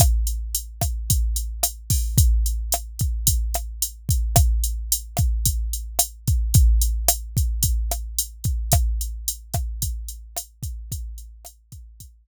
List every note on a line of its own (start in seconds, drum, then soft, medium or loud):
0.00 kick medium
0.00 cross-stick medium
0.00 closed hi-hat loud
0.27 closed hi-hat medium
0.55 closed hi-hat medium
0.81 kick medium
0.81 cross-stick medium
0.81 closed hi-hat medium
1.10 kick medium
1.10 closed hi-hat medium
1.36 closed hi-hat medium
1.63 cross-stick medium
1.63 closed hi-hat loud
1.90 kick medium
1.90 open hi-hat medium
2.18 kick medium
2.18 closed hi-hat medium
2.46 closed hi-hat medium
2.72 cross-stick medium
2.72 closed hi-hat medium
2.99 kick medium
2.99 closed hi-hat medium
3.27 kick medium
3.27 closed hi-hat loud
3.54 cross-stick medium
3.54 closed hi-hat medium
3.82 closed hi-hat medium
4.09 kick medium
4.09 closed hi-hat medium
4.36 kick medium
4.36 cross-stick loud
4.36 closed hi-hat medium
4.64 closed hi-hat medium
4.92 closed hi-hat loud
5.17 kick medium
5.17 cross-stick medium
5.17 closed hi-hat medium
5.45 kick medium
5.45 closed hi-hat medium
5.73 closed hi-hat medium
5.99 cross-stick medium
5.99 closed hi-hat loud
6.28 kick medium
6.28 closed hi-hat medium
6.54 kick loud
6.54 closed hi-hat medium
6.81 closed hi-hat medium
7.08 cross-stick medium
7.08 closed hi-hat loud
7.37 kick medium
7.37 closed hi-hat medium
7.63 kick medium
7.63 closed hi-hat medium
7.91 cross-stick medium
7.91 closed hi-hat medium
8.19 closed hi-hat medium
8.44 kick medium
8.44 closed hi-hat medium
8.72 kick medium
8.72 cross-stick loud
8.72 closed hi-hat medium
9.01 closed hi-hat medium
9.28 closed hi-hat medium
9.54 kick medium
9.54 cross-stick medium
9.54 closed hi-hat medium
9.82 kick medium
9.82 closed hi-hat medium
10.09 closed hi-hat medium
10.36 cross-stick medium
10.36 closed hi-hat loud
10.63 kick medium
10.63 closed hi-hat medium
10.92 kick medium
10.92 closed hi-hat medium
11.18 closed hi-hat medium
11.45 cross-stick medium
11.45 closed hi-hat medium
11.72 kick medium
11.72 closed hi-hat medium
12.00 kick medium
12.00 closed hi-hat loud